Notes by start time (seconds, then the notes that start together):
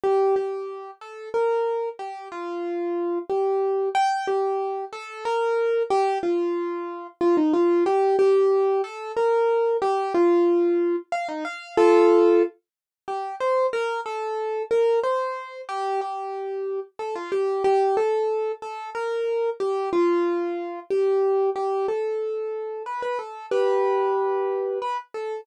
0.04 G4
0.36 G4
1.01 A4
1.34 A#4
1.99 G4
2.32 F4
3.30 G4
3.95 G5
4.27 G4
4.93 A4
5.25 A#4
5.90 G4
6.23 F4
7.21 F4
7.37 D#4
7.54 F4
7.86 G4
8.19 G4
8.84 A4
9.17 A#4
9.82 G4
10.14 F4
11.12 F5
11.29 D#4
11.45 F5
11.77 F4 A4
13.08 G4
13.40 C5
13.73 A#4
14.06 A4
14.71 A#4
15.04 C5
15.69 G4
16.01 G4
16.99 A4
17.15 F4
17.32 G4
17.64 G4
17.97 A4
18.62 A4
18.95 A#4
19.60 G4
19.93 F4
20.90 G4
21.56 G4
21.88 A4
22.86 B4
23.02 B4
23.19 A4
23.51 G4 B4
24.82 B4
25.14 A4